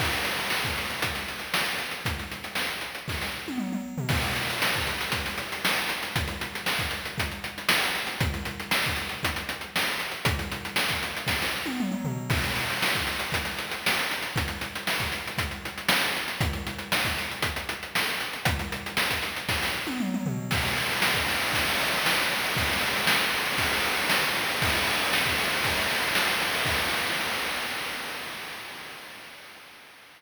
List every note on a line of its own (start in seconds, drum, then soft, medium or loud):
0.00 kick loud
0.00 crash loud
0.13 closed hi-hat medium
0.25 closed hi-hat medium
0.39 closed hi-hat medium
0.50 snare loud
0.65 kick loud
0.65 closed hi-hat medium
0.78 closed hi-hat medium
0.90 closed hi-hat medium
1.02 kick medium
1.02 closed hi-hat loud
1.15 closed hi-hat medium
1.28 closed hi-hat medium
1.39 closed hi-hat medium
1.54 snare loud
1.66 closed hi-hat medium
1.78 closed hi-hat medium
1.91 closed hi-hat medium
2.05 kick loud
2.05 closed hi-hat loud
2.19 closed hi-hat medium
2.32 closed hi-hat medium
2.44 closed hi-hat medium
2.55 snare loud
2.68 closed hi-hat medium
2.81 closed hi-hat medium
2.95 closed hi-hat medium
3.08 kick loud
3.08 snare medium
3.21 snare medium
3.48 high tom medium
3.58 mid tom medium
3.73 mid tom medium
3.98 floor tom loud
4.09 kick loud
4.09 crash loud
4.23 closed hi-hat medium
4.36 closed hi-hat medium
4.50 closed hi-hat medium
4.62 snare loud
4.73 kick loud
4.73 closed hi-hat medium
4.87 closed hi-hat medium
5.01 closed hi-hat loud
5.12 kick loud
5.12 closed hi-hat loud
5.26 closed hi-hat medium
5.38 closed hi-hat medium
5.52 closed hi-hat medium
5.65 snare loud
5.76 closed hi-hat medium
5.89 closed hi-hat loud
6.03 closed hi-hat medium
6.16 kick loud
6.16 closed hi-hat loud
6.27 closed hi-hat medium
6.41 closed hi-hat medium
6.55 closed hi-hat medium
6.66 snare loud
6.79 kick loud
6.79 closed hi-hat medium
6.91 closed hi-hat medium
7.05 closed hi-hat medium
7.18 kick loud
7.18 closed hi-hat loud
7.31 closed hi-hat medium
7.44 closed hi-hat medium
7.58 closed hi-hat medium
7.69 snare loud
7.83 closed hi-hat medium
7.95 closed hi-hat medium
8.07 closed hi-hat medium
8.21 kick loud
8.21 closed hi-hat loud
8.34 closed hi-hat medium
8.45 closed hi-hat medium
8.60 closed hi-hat medium
8.71 snare loud
8.84 kick loud
8.84 closed hi-hat medium
8.96 closed hi-hat medium
9.09 closed hi-hat medium
9.23 kick loud
9.23 closed hi-hat loud
9.36 closed hi-hat loud
9.49 closed hi-hat loud
9.61 closed hi-hat medium
9.76 snare loud
9.87 closed hi-hat medium
10.00 closed hi-hat medium
10.11 closed hi-hat medium
10.25 kick loud
10.25 closed hi-hat loud
10.39 closed hi-hat medium
10.52 closed hi-hat medium
10.65 closed hi-hat medium
10.76 snare loud
10.89 kick medium
10.89 closed hi-hat loud
11.03 closed hi-hat loud
11.17 closed hi-hat medium
11.27 kick loud
11.27 snare loud
11.42 snare loud
11.66 high tom medium
11.80 mid tom loud
11.92 mid tom loud
12.05 floor tom loud
12.30 kick loud
12.30 crash loud
12.44 closed hi-hat medium
12.56 closed hi-hat medium
12.70 closed hi-hat medium
12.82 snare loud
12.95 kick loud
12.95 closed hi-hat medium
13.07 closed hi-hat medium
13.19 closed hi-hat loud
13.32 kick loud
13.32 closed hi-hat loud
13.45 closed hi-hat medium
13.58 closed hi-hat medium
13.71 closed hi-hat medium
13.86 snare loud
13.99 closed hi-hat medium
14.11 closed hi-hat loud
14.22 closed hi-hat medium
14.36 kick loud
14.36 closed hi-hat loud
14.48 closed hi-hat medium
14.61 closed hi-hat medium
14.76 closed hi-hat medium
14.87 snare loud
15.00 kick loud
15.00 closed hi-hat medium
15.12 closed hi-hat medium
15.27 closed hi-hat medium
15.38 kick loud
15.38 closed hi-hat loud
15.51 closed hi-hat medium
15.65 closed hi-hat medium
15.78 closed hi-hat medium
15.89 snare loud
16.02 closed hi-hat medium
16.16 closed hi-hat medium
16.28 closed hi-hat medium
16.41 kick loud
16.41 closed hi-hat loud
16.53 closed hi-hat medium
16.67 closed hi-hat medium
16.79 closed hi-hat medium
16.92 snare loud
17.05 kick loud
17.05 closed hi-hat medium
17.18 closed hi-hat medium
17.31 closed hi-hat medium
17.42 kick loud
17.42 closed hi-hat loud
17.56 closed hi-hat loud
17.69 closed hi-hat loud
17.83 closed hi-hat medium
17.95 snare loud
18.08 closed hi-hat medium
18.20 closed hi-hat medium
18.33 closed hi-hat medium
18.45 kick loud
18.45 closed hi-hat loud
18.59 closed hi-hat medium
18.72 closed hi-hat medium
18.86 closed hi-hat medium
18.97 snare loud
19.11 kick medium
19.11 closed hi-hat loud
19.23 closed hi-hat loud
19.36 closed hi-hat medium
19.49 kick loud
19.49 snare loud
19.63 snare loud
19.87 high tom medium
20.00 mid tom loud
20.14 mid tom loud
20.26 floor tom loud
20.51 kick loud
20.51 crash loud
20.63 ride medium
20.77 ride medium
20.90 ride medium
21.02 snare loud
21.15 kick loud
21.15 ride medium
21.28 ride loud
21.42 ride medium
21.53 kick loud
21.53 ride loud
21.67 ride medium
21.80 ride medium
21.92 ride medium
22.06 snare loud
22.18 ride medium
22.30 ride medium
22.44 ride medium
22.57 kick loud
22.57 ride loud
22.70 ride medium
22.81 ride medium
22.94 ride medium
23.07 snare loud
23.19 ride medium
23.34 ride medium
23.45 ride medium
23.58 kick loud
23.58 ride loud
23.73 ride medium
23.84 ride medium
23.98 ride medium
24.10 snare loud
24.23 ride medium
24.35 ride medium
24.49 ride medium
24.62 kick loud
24.62 ride loud
24.75 ride medium
24.88 ride medium
24.99 ride medium
25.13 snare loud
25.26 kick loud
25.26 ride medium
25.38 ride loud
25.52 ride medium
25.64 kick loud
25.64 ride loud
25.77 ride medium
25.89 ride medium
26.03 ride medium
26.15 snare loud
26.27 ride medium
26.42 ride medium
26.55 ride medium
26.66 kick loud
26.66 crash loud